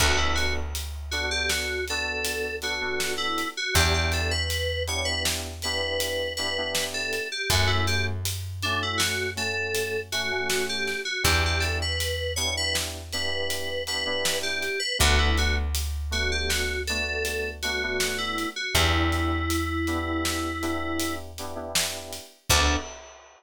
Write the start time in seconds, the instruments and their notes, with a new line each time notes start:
0.00 electric bass (finger) D2, electric piano 2 B3 D4 F#4 A4, kick, crash
0.18 electric piano 2 E4
0.35 electric piano 2 F#4, closed hi-hat
0.75 closed hi-hat
1.11 electric piano 2 B3 D4 F#4 A4, closed hi-hat
1.31 electric piano 2 G4
1.49 electric piano 2 F#4, snare
1.88 electric piano 2 B3 D4 F#4 A4, closed hi-hat
2.25 closed hi-hat
2.62 electric piano 2 B3 D4 F#4 A4, closed hi-hat
2.81 electric piano 2 B3 D4 F#4 A4
3.00 snare
3.18 electric piano 2 E4
3.38 closed hi-hat
3.57 electric piano 2 F#4
3.74 electric bass (finger) E2, electric piano 2 B3 D4 E4 G4, kick, closed hi-hat
3.94 electric piano 2 G4
4.12 electric piano 2 A4, closed hi-hat
4.31 electric piano 2 B4
4.50 closed hi-hat
4.87 electric piano 2 B3 D4 E4 G4 C#5, closed hi-hat
5.05 electric piano 2 B4
5.25 snare
5.62 electric piano 2 B3 D4 E4 G4 B4, closed hi-hat
6.00 closed hi-hat
6.37 electric piano 2 B3 D4 E4 G4 B4, closed hi-hat
6.57 electric piano 2 B3 D4 E4 G4
6.75 snare
6.94 electric piano 2 A4
7.13 closed hi-hat
7.32 electric piano 2 G4
7.50 electric bass (finger) F#2, electric piano 2 A3 C#4 F#4, kick, closed hi-hat
7.67 electric piano 2 E4
7.87 electric piano 2 G4, closed hi-hat
8.25 closed hi-hat
8.62 electric piano 2 A3 C#4 D4 F#4, closed hi-hat
8.83 electric piano 2 E4
8.98 electric piano 2 F#4, snare
9.36 electric piano 2 A3 C#4 F#4 A4, closed hi-hat
9.75 closed hi-hat
10.12 electric piano 2 A3 C#4 F#4, closed hi-hat
10.30 electric piano 2 A3 C#4 F#4
10.50 snare
10.69 electric piano 2 G4
10.87 snare
11.05 electric piano 2 F#4
11.23 electric bass (finger) E2, electric piano 2 B3 D4 E4 G4, kick, closed hi-hat
11.46 electric piano 2 G4
11.60 electric piano 2 A4, closed hi-hat
11.82 electric piano 2 B4
12.00 closed hi-hat
12.36 electric piano 2 B3 D4 E4 G4 C#5, closed hi-hat
12.57 electric piano 2 B4
12.75 snare
13.12 electric piano 2 B3 D4 E4 G4 B4, closed hi-hat
13.50 closed hi-hat
13.87 electric piano 2 B3 D4 E4 G4 B4, closed hi-hat
14.06 electric piano 2 B3 D4 E4 G4
14.25 snare
14.43 electric piano 2 G4
14.62 closed hi-hat
14.80 electric piano 2 B4
14.99 electric bass (finger) D2, electric piano 2 A3 B3 D4 F#4, kick, closed hi-hat
15.19 electric piano 2 E4
15.38 electric piano 2 F#4, closed hi-hat
15.75 closed hi-hat
16.11 electric piano 2 A3 B3 D4 F#4, closed hi-hat
16.32 electric piano 2 G4
16.49 electric piano 2 F#4, snare
16.87 electric piano 2 A3 B3 D4 F#4 A4, closed hi-hat
17.25 closed hi-hat
17.63 electric piano 2 A3 B3 D4 F#4, closed hi-hat
17.83 electric piano 2 A3 B3 D4 F#4
18.00 snare
18.18 electric piano 2 E4
18.38 closed hi-hat
18.56 electric piano 2 F#4
18.75 electric bass (finger) E2, electric piano 2 B3 D4 E4 G4, kick, closed hi-hat
19.12 closed hi-hat
19.50 closed hi-hat
19.87 electric piano 2 B3 D4 E4 G4, closed hi-hat
20.25 snare
20.62 electric piano 2 B3 D4 E4 G4, closed hi-hat
21.00 closed hi-hat
21.38 electric piano 2 B3 D4 E4 G4, closed hi-hat
21.55 electric piano 2 B3 D4 E4 G4
21.75 snare
22.13 closed hi-hat
22.50 electric bass (finger) D2, electric piano 2 B3 D4 F#4 A4, kick, crash